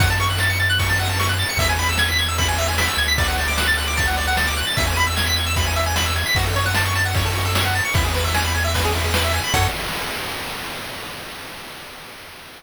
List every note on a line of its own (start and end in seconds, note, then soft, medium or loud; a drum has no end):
0.00 1.45 F#2 medium
0.00 0.09 F#5 medium
0.00 kick loud
0.00 ride loud
0.10 0.19 A5 medium
0.20 0.29 C#6 medium
0.20 ride medium
0.30 0.39 F#6 medium
0.38 0.49 A6 medium
0.38 snare loud
0.50 0.59 C#7 medium
0.59 0.68 A6 medium
0.59 ride medium
0.70 0.78 F#6 medium
0.79 0.88 C#6 medium
0.79 kick loud
0.79 ride loud
0.89 0.98 A5 medium
0.99 1.08 F#5 medium
0.99 ride medium
1.09 1.18 A5 medium
1.19 1.28 C#6 medium
1.19 snare loud
1.29 1.38 F#6 medium
1.39 1.48 A6 medium
1.39 ride medium
1.49 1.58 C#7 medium
1.57 2.89 E2 medium
1.57 1.68 E5 loud
1.57 kick loud
1.57 ride loud
1.69 1.78 G#5 medium
1.79 1.88 B5 medium
1.79 ride medium
1.89 1.98 E6 medium
1.98 2.08 G#6 medium
1.98 snare loud
2.09 2.18 B6 medium
2.19 2.27 G#6 medium
2.19 ride medium
2.28 2.37 E6 medium
2.38 2.47 B5 medium
2.38 kick medium
2.38 ride loud
2.48 2.57 G#5 medium
2.58 2.67 E5 medium
2.58 ride medium
2.68 2.77 G#5 medium
2.78 2.87 B5 medium
2.78 snare loud
2.88 2.97 E6 medium
2.97 4.63 D2 medium
2.97 3.07 G#6 medium
2.97 ride medium
3.08 3.17 B6 medium
3.18 3.27 D5 medium
3.18 kick loud
3.18 ride loud
3.28 3.37 F#5 medium
3.38 3.47 A5 medium
3.38 ride medium
3.48 3.57 D6 medium
3.58 3.67 F#6 medium
3.58 snare loud
3.67 3.76 A6 medium
3.77 3.86 F#6 medium
3.77 ride medium
3.88 3.96 D6 medium
3.97 4.06 A5 medium
3.97 kick loud
3.97 ride loud
4.07 4.16 F#5 medium
4.17 4.26 D5 medium
4.17 ride medium
4.27 4.36 F#5 medium
4.37 4.46 A5 medium
4.37 snare loud
4.47 4.56 D6 medium
4.57 4.66 F#6 medium
4.57 ride medium
4.67 4.76 A6 medium
4.77 6.24 E2 medium
4.77 4.86 E5 medium
4.77 kick loud
4.77 ride loud
4.87 4.96 G#5 medium
4.96 5.06 B5 medium
4.96 ride medium
5.07 5.16 E6 medium
5.16 5.25 G#6 medium
5.16 snare loud
5.26 5.35 B6 medium
5.36 5.45 G#6 medium
5.36 ride medium
5.46 5.55 E6 medium
5.56 5.65 B5 medium
5.56 kick loud
5.56 ride loud
5.66 5.75 G#5 medium
5.76 5.85 E5 medium
5.76 ride medium
5.86 5.95 G#5 medium
5.96 6.05 B5 medium
5.96 snare loud
6.06 6.15 E6 medium
6.16 6.25 G#6 medium
6.16 ride medium
6.26 6.35 B6 medium
6.35 7.81 F#2 medium
6.35 6.45 F#4 medium
6.35 kick loud
6.35 ride loud
6.46 6.55 A4 medium
6.56 6.65 C#5 medium
6.56 ride medium
6.66 6.75 F#5 medium
6.75 6.84 A5 medium
6.75 snare loud
6.85 6.94 C#6 medium
6.95 7.04 A5 medium
6.95 ride medium
7.05 7.14 F#5 medium
7.15 7.24 C#5 medium
7.15 kick loud
7.15 ride loud
7.25 7.34 A4 medium
7.35 7.44 F#4 medium
7.35 ride medium
7.45 7.54 A4 medium
7.55 7.64 C#5 medium
7.55 snare loud
7.65 7.74 F#5 medium
7.75 7.84 A5 medium
7.75 ride medium
7.85 7.94 C#6 medium
7.94 9.40 E2 medium
7.94 8.04 E4 medium
7.94 kick loud
7.94 ride loud
8.05 8.14 G#4 medium
8.14 8.24 B4 medium
8.14 ride medium
8.24 8.33 E5 medium
8.34 8.43 G#5 medium
8.34 snare loud
8.44 8.53 B5 medium
8.54 8.63 G#5 medium
8.54 ride medium
8.64 8.73 E5 medium
8.74 8.83 B4 medium
8.74 kick medium
8.74 ride loud
8.84 8.93 G#4 medium
8.94 9.03 E4 medium
8.94 ride medium
9.04 9.13 G#4 medium
9.14 9.23 B4 medium
9.14 snare loud
9.24 9.33 E5 medium
9.33 9.43 G#5 medium
9.33 ride medium
9.44 9.53 B5 medium
9.54 9.68 F#2 loud
9.54 9.68 F#4 loud
9.54 9.68 A4 loud
9.54 9.68 C#5 loud
9.54 kick loud
9.54 crash loud